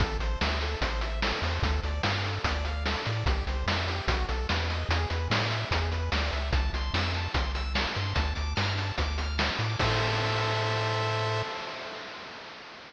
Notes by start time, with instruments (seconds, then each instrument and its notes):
0.00 synth bass 1 A1, lead 1 (square) A4, kick, closed hi-hat
0.19 synth bass 1 A1, lead 1 (square) C5, closed hi-hat
0.41 synth bass 1 D2, lead 1 (square) E5, snare
0.61 lead 1 (square) A4, closed hi-hat
0.81 synth bass 1 A1, lead 1 (square) C5, kick, closed hi-hat
1.01 lead 1 (square) E5, closed hi-hat
1.22 lead 1 (square) A4, snare
1.42 synth bass 1 E2, lead 1 (square) C5, open hi-hat
1.62 synth bass 1 D2, lead 1 (square) A4, kick, closed hi-hat
1.83 synth bass 1 D2, lead 1 (square) D5, closed hi-hat
2.03 synth bass 1 G2, lead 1 (square) F5, snare
2.24 lead 1 (square) A4, closed hi-hat
2.44 synth bass 1 D2, lead 1 (square) D5, kick, closed hi-hat
2.65 lead 1 (square) F5, closed hi-hat
2.86 lead 1 (square) A4, snare
3.06 synth bass 1 A2, lead 1 (square) D5, closed hi-hat
3.26 synth bass 1 C2, lead 1 (square) G4, kick, closed hi-hat
3.47 synth bass 1 C2, lead 1 (square) C5, closed hi-hat
3.66 synth bass 1 F2, lead 1 (square) E5, snare
3.88 lead 1 (square) G4, closed hi-hat
4.08 synth bass 1 B1, lead 1 (square) F#4, kick, closed hi-hat
4.29 synth bass 1 B1, lead 1 (square) A4, closed hi-hat
4.49 synth bass 1 E2, lead 1 (square) B4, snare
4.70 lead 1 (square) D#5, closed hi-hat
4.89 synth bass 1 E2, lead 1 (square) G#4, closed hi-hat
5.10 synth bass 1 E2, lead 1 (square) B4, closed hi-hat
5.30 synth bass 1 A2, lead 1 (square) D5, snare
5.51 lead 1 (square) E5, closed hi-hat
5.71 synth bass 1 E2, lead 1 (square) G#4, kick, closed hi-hat
5.92 lead 1 (square) B4, closed hi-hat
6.12 synth bass 1 D2, lead 1 (square) D5, snare
6.31 synth bass 1 C#2, lead 1 (square) E5, closed hi-hat
6.53 synth bass 1 C2, lead 1 (square) A5, kick, closed hi-hat
6.73 synth bass 1 C2, lead 1 (square) C6, closed hi-hat
6.94 synth bass 1 F2, lead 1 (square) E6, snare
7.14 lead 1 (square) A5, closed hi-hat
7.34 synth bass 1 C2, lead 1 (square) C6, kick, closed hi-hat
7.55 lead 1 (square) E6, closed hi-hat
7.74 lead 1 (square) A5, snare
7.95 synth bass 1 G2, lead 1 (square) C6, closed hi-hat
8.15 synth bass 1 D2, lead 1 (square) A5, kick, closed hi-hat
8.35 synth bass 1 D2, lead 1 (square) D6, closed hi-hat
8.56 synth bass 1 G2, lead 1 (square) F6, snare
8.77 lead 1 (square) A5, closed hi-hat
8.98 synth bass 1 D2, lead 1 (square) D6, kick, closed hi-hat
9.18 lead 1 (square) F6, closed hi-hat
9.38 lead 1 (square) A5, snare
9.59 synth bass 1 A2, lead 1 (square) D6, closed hi-hat
9.79 synth bass 1 A2, lead 1 (square) A4 C5 E5, kick, crash